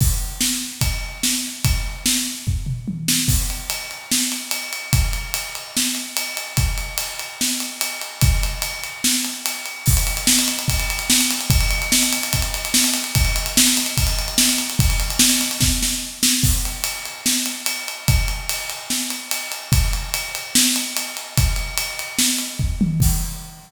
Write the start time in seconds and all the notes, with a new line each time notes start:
0.01 kick, crash
0.41 snare
0.81 kick, ride
1.23 snare
1.65 kick, ride
2.06 snare
2.47 kick, floor tom
2.66 mid tom
2.88 high tom
3.08 snare
3.28 kick, crash
3.50 ride
3.70 ride
3.91 ride
4.11 snare
4.32 ride
4.51 ride
4.73 ride
4.93 kick, ride
5.13 ride
5.34 ride
5.55 ride
5.77 snare
5.95 ride
6.17 ride
6.37 ride
6.57 kick, ride
6.78 ride
6.98 ride
7.19 ride
7.41 snare
7.60 ride
7.81 ride
8.01 ride
8.21 kick, ride
8.43 ride
8.62 ride
8.84 ride
9.04 snare
9.25 ride
9.46 ride
9.66 ride
9.86 kick, crash
9.97 ride
10.07 ride
10.17 ride
10.27 snare
10.39 ride
10.48 ride
10.59 ride
10.68 kick, ride
10.80 ride
10.90 ride
10.99 ride
11.10 snare
11.21 ride
11.31 ride
11.41 ride
11.50 kick, ride
11.61 ride
11.71 ride
11.82 ride
11.92 snare
12.03 ride
12.13 ride
12.23 ride
12.33 kick, ride
12.42 ride
12.54 ride
12.65 ride
12.74 snare
12.84 ride
12.94 ride
13.04 ride
13.15 kick, ride
13.25 ride
13.36 ride
13.46 ride
13.57 snare
13.67 ride
13.77 ride
13.86 ride
13.97 kick, ride
14.07 ride
14.19 ride
14.28 ride
14.38 snare
14.49 ride
14.58 ride
14.70 ride
14.79 kick, ride
14.90 ride
15.00 ride
15.10 ride
15.19 snare
15.30 ride
15.41 ride
15.51 ride
15.61 kick, snare
15.83 snare
16.23 snare
16.43 kick, crash
16.65 ride
16.84 ride
17.05 ride
17.26 snare
17.46 ride
17.66 ride
17.88 ride
18.08 kick, ride
18.28 ride
18.49 ride
18.70 ride
18.90 snare
19.10 ride
19.31 ride
19.52 ride
19.72 kick, ride
19.93 ride
20.14 ride
20.35 ride
20.55 snare
20.76 ride
20.97 ride
21.17 ride
21.38 kick, ride
21.56 ride
21.78 ride
21.99 ride
22.19 snare
22.38 ride
22.59 kick, floor tom
22.81 high tom
23.00 kick, crash